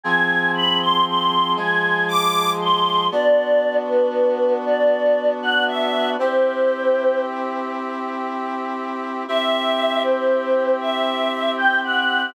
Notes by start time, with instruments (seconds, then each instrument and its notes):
0.04 brass section F3 C4 G#4, choir aahs G#5
0.55 choir aahs B5
0.81 choir aahs C6
1.07 choir aahs C6
1.56 brass section F3 G#3 G#4, choir aahs G#5
2.08 choir aahs D6
2.61 choir aahs C6
3.12 brass section B3 D4 F#4, choir aahs D5
3.87 choir aahs B4
4.65 choir aahs D5
5.42 choir aahs F#5
5.67 choir aahs E5
6.19 brass section C4 E4 G4, choir aahs C5
9.28 brass section C4 E4 G4, choir aahs E5
10.02 choir aahs C5
10.81 choir aahs E5
11.57 choir aahs G5
11.83 choir aahs F#5